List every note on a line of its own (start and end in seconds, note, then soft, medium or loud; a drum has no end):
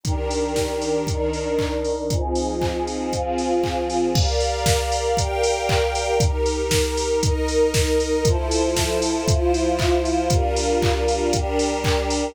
0.04 1.06 D#3 medium
0.04 1.06 D4 medium
0.04 1.05 D#4 medium
0.04 1.06 G4 medium
0.04 1.06 A#4 medium
0.04 1.05 D5 medium
0.04 1.05 G5 medium
0.04 1.05 A#5 medium
0.04 kick loud
0.04 closed hi-hat loud
0.31 open hi-hat medium
0.56 kick medium
0.56 snare loud
0.82 open hi-hat medium
1.07 2.09 D#3 medium
1.07 2.09 D4 medium
1.07 2.09 D#4 medium
1.07 2.09 A#4 medium
1.07 2.09 D5 medium
1.07 2.09 D#5 medium
1.07 2.09 A#5 medium
1.07 kick loud
1.07 closed hi-hat loud
1.33 open hi-hat medium
1.59 kick medium
1.59 clap loud
1.85 open hi-hat medium
2.10 3.12 F3 medium
2.10 3.12 C4 medium
2.10 3.12 D#4 medium
2.10 3.12 F4 medium
2.10 3.12 G#4 medium
2.10 3.12 C5 medium
2.10 3.13 D#5 medium
2.10 3.12 G#5 medium
2.10 kick loud
2.10 closed hi-hat loud
2.35 open hi-hat medium
2.61 kick medium
2.61 clap loud
2.87 open hi-hat medium
3.12 4.15 F3 medium
3.12 4.15 C4 medium
3.12 4.14 F4 medium
3.12 4.15 F4 medium
3.12 4.15 G#4 medium
3.12 4.14 C5 medium
3.12 4.14 F5 medium
3.12 4.14 G#5 medium
3.12 kick medium
3.12 closed hi-hat loud
3.38 open hi-hat medium
3.63 kick medium
3.63 clap loud
3.90 open hi-hat medium
4.15 5.17 G4 loud
4.15 5.17 G4 medium
4.15 5.17 A#4 medium
4.15 5.17 D5 loud
4.15 5.17 D5 medium
4.15 5.17 F5 medium
4.15 5.17 A#5 medium
4.15 kick loud
4.15 crash loud
4.40 open hi-hat loud
4.66 kick loud
4.66 snare loud
4.92 open hi-hat loud
5.17 6.19 G4 medium
5.17 6.20 G4 medium
5.17 6.19 A#4 loud
5.17 6.20 D5 medium
5.17 6.19 F5 medium
5.17 6.19 G5 loud
5.17 6.20 G5 medium
5.17 6.20 A#5 medium
5.17 kick loud
5.17 closed hi-hat loud
5.43 open hi-hat loud
5.69 kick loud
5.69 clap loud
5.95 open hi-hat loud
6.20 7.22 D#4 medium
6.20 7.23 D#4 medium
6.20 7.22 G4 loud
6.20 7.23 G4 medium
6.20 7.22 A#4 loud
6.20 7.23 A#5 loud
6.20 kick loud
6.20 closed hi-hat loud
6.46 open hi-hat loud
6.71 kick loud
6.71 snare loud
6.97 open hi-hat loud
7.22 8.24 D#4 loud
7.22 8.25 D#4 medium
7.22 8.24 A#4 loud
7.22 8.25 A#4 medium
7.22 8.24 D#5 loud
7.22 8.25 A#5 medium
7.22 kick loud
7.22 closed hi-hat loud
7.48 open hi-hat loud
7.74 kick loud
7.74 snare loud
8.00 open hi-hat loud
8.25 9.26 F3 loud
8.25 9.26 E4 loud
8.25 9.26 F4 medium
8.25 9.26 A4 loud
8.25 9.26 C5 loud
8.25 9.26 E5 medium
8.25 9.27 A5 medium
8.25 9.26 C6 medium
8.25 kick loud
8.25 closed hi-hat loud
8.51 open hi-hat loud
8.76 kick loud
8.76 snare loud
9.02 open hi-hat loud
9.26 10.30 F3 loud
9.26 10.30 E4 loud
9.26 10.28 F4 medium
9.26 10.30 F4 medium
9.26 10.30 C5 loud
9.26 10.28 E5 medium
9.26 10.28 F5 medium
9.26 10.28 C6 loud
9.26 kick loud
9.26 closed hi-hat loud
9.54 open hi-hat loud
9.79 kick loud
9.79 clap loud
10.05 open hi-hat loud
10.30 11.32 G3 loud
10.30 11.32 D4 medium
10.30 11.32 F4 loud
10.30 11.32 G4 medium
10.30 11.32 A#4 loud
10.30 11.32 D5 medium
10.30 11.32 F5 loud
10.30 11.32 A#5 medium
10.30 kick loud
10.30 closed hi-hat loud
10.56 open hi-hat loud
10.82 kick loud
10.82 clap loud
11.08 open hi-hat loud
11.33 12.35 G3 medium
11.33 12.35 D4 loud
11.33 12.35 G4 loud
11.33 12.35 A#4 medium
11.33 12.35 D5 medium
11.33 12.35 G5 loud
11.33 12.35 A#5 medium
11.33 kick loud
11.33 closed hi-hat loud
11.59 open hi-hat loud
11.84 kick loud
11.84 clap loud
12.10 open hi-hat loud